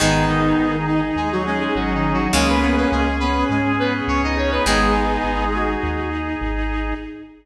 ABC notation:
X:1
M:4/4
L:1/16
Q:1/4=103
K:G#m
V:1 name="Lead 2 (sawtooth)"
[D,D]2 [D,D]6 [G,G] [F,F] [G,G] [G,G] (3[F,F]2 [D,D]2 [F,F]2 | [G,G] [B,B] [B,B] [B,B] [G,G]2 [B,B]2 [G,G]2 [B,B] z [Cc] [Dd] [Cc] [B,B] | [G,G]8 z8 |]
V:2 name="Clarinet"
[B,D]6 D4 C6 | [A,C]6 C4 B,6 | [B,D]6 F4 z6 |]
V:3 name="Acoustic Guitar (steel)" clef=bass
[D,G,]16 | [C,G,]16 | [D,G,]16 |]
V:4 name="Drawbar Organ"
[DG]16 | [CG]14 [DG]2- | [DG]16 |]
V:5 name="Synth Bass 1" clef=bass
G,,,4 G,,,4 D,,4 G,,,4 | C,,4 C,,4 G,,4 C,,4 | G,,,4 G,,,4 D,,4 G,,,4 |]
V:6 name="String Ensemble 1"
[DG]16 | [CG]16 | [DG]16 |]